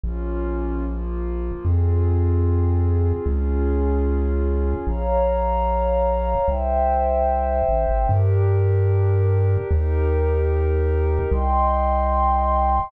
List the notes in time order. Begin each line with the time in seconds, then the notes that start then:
0.04 A#1 A#3 C#4 F4
0.86 F3 A#3 F4
1.65 F2 C4 F4 G#4
3.26 C#2 C#4 F4 G#4
4.87 A#1 C#5 F5 A#5
6.47 C2 C5 E5 G5
7.69 A1
7.89 G#1
8.08 G2 D4 G4 A#4
9.70 D#2 D#4 G4 A#4
11.31 C2 D#5 G5 C6